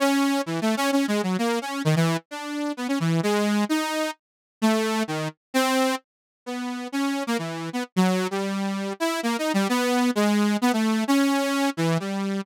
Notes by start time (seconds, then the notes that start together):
0.00 C#4
0.46 E3
0.62 A3
0.77 C#4
0.92 C#4
1.08 G#3
1.23 F#3
1.38 A#3
1.62 C#4
1.85 D#3
1.96 E3
2.31 D4
2.77 B3
2.88 C#4
3.00 E3
3.23 G#3
3.69 D#4
4.62 A3
5.08 D#3
5.54 C4
6.46 B3
6.92 C#4
7.27 A#3
7.38 E3
7.73 B3
7.96 F#3
8.31 G3
9.00 E4
9.23 A#3
9.39 D#4
9.54 G3
9.69 B3
10.15 G#3
10.62 B3
10.73 A3
11.08 C#4
11.77 E3
12.00 G3